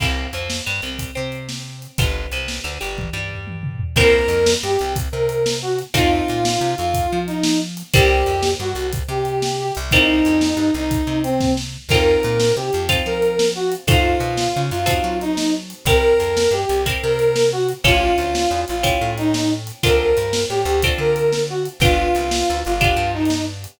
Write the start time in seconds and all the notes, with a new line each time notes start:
0.00 C2 A#3 C4 E4 G4, kick, crash
0.33 F2 F3, closed hi-hat
0.50 snare
0.66 G2 G3
0.82 C2 C3, closed hi-hat
0.99 kick, closed hi-hat
1.15 C3 C4
1.32 closed hi-hat
1.49 snare
1.82 closed hi-hat
1.98 G1 B3 D4 F4 G4, kick, closed hi-hat
2.31 C2 C3, closed hi-hat
2.48 snare
2.64 D2 D3
2.81 G1 G3, closed hi-hat
2.98 kick, high tom
3.13 G2 G3
3.31 floor tom
3.47 high tom
3.63 mid tom
3.80 floor tom
3.96 C2 A#3 C4 E4 G4 A#4, kick, crash
4.28 F2, closed hi-hat
4.46 snare
4.63 G2 G4
4.79 C2, closed hi-hat
4.96 kick, closed hi-hat
5.12 C3 A#4
5.29 closed hi-hat
5.46 snare
5.62 F#4
5.79 closed hi-hat
5.94 F2 A3 C4 D#4 F4, kick, closed hi-hat
6.28 A#2, closed hi-hat
6.45 snare
6.61 C3
6.78 F2 F4, closed hi-hat
6.94 kick, closed hi-hat
7.12 F3
7.27 D#4, closed hi-hat
7.43 snare
7.77 closed hi-hat
7.93 C2 G3 A#3 C4 E4 G4, kick, closed hi-hat
8.26 F2, closed hi-hat
8.43 snare
8.60 G2 F#4
8.75 C2, closed hi-hat
8.93 kick, closed hi-hat
9.08 C3 G4
9.25 closed hi-hat
9.42 snare
9.59 G4
9.75 C2, closed hi-hat
9.91 G3 A#3 C4 D#4 E4, kick, closed hi-hat
10.25 F2, closed hi-hat
10.41 snare
10.57 G2
10.74 C2 D#4, closed hi-hat
10.91 kick, closed hi-hat
11.07 C3
11.23 C4, closed hi-hat
11.40 kick, snare
11.57 snare
11.89 F2 C4 D#4 F4 A4 A#4, kick, crash
12.23 A#2, closed hi-hat
12.40 snare
12.56 C3 G4
12.73 F2, closed hi-hat
12.89 C4 D#4 F4 A4, kick, closed hi-hat
13.06 F3 A#4
13.22 closed hi-hat
13.39 snare
13.55 F#4
13.72 closed hi-hat
13.87 F#2 C4 D#4 F4 F#4 A4, kick, closed hi-hat
14.20 B2, closed hi-hat
14.37 snare
14.56 C#3
14.71 F#2 F4, closed hi-hat
14.86 C4 D#4 F#4 A4, kick, closed hi-hat
15.04 F#3
15.21 D#4, closed hi-hat
15.37 snare
15.70 closed hi-hat
15.85 C2 C4 E4 G4 A#4, kick, closed hi-hat
16.19 F2, closed hi-hat
16.37 snare
16.51 G2 G4
16.69 C2, closed hi-hat
16.86 C4 E4 G4 A#4, kick, closed hi-hat
17.03 C3 A#4
17.19 closed hi-hat
17.36 snare
17.52 F#4
17.69 closed hi-hat
17.84 A1 C#4 E4 F4 G4 A4, kick, closed hi-hat
18.18 D2, closed hi-hat
18.35 snare
18.51 E2
18.68 A1 F4, closed hi-hat
18.83 C#4 E4 G4 A4, kick, closed hi-hat
19.01 A2
19.18 D#4, closed hi-hat
19.34 snare
19.67 closed hi-hat
19.83 D2 C4 D4 F4 A4 A#4, kick, closed hi-hat
20.17 G2, closed hi-hat
20.33 snare
20.49 A2 G4
20.65 D2, closed hi-hat
20.82 C4 D4 F4 A4, kick, closed hi-hat
20.98 D3 A#4
21.16 closed hi-hat
21.33 snare
21.49 F#4
21.65 closed hi-hat
21.80 G1 B3 D4 F4 G4, kick, closed hi-hat
22.15 C2, closed hi-hat
22.31 snare
22.50 D2
22.65 G1 F4, closed hi-hat
22.81 B3 D4 F4 G4, kick, closed hi-hat
22.96 G2
23.14 D#4
23.25 closed hi-hat
23.30 snare
23.64 closed hi-hat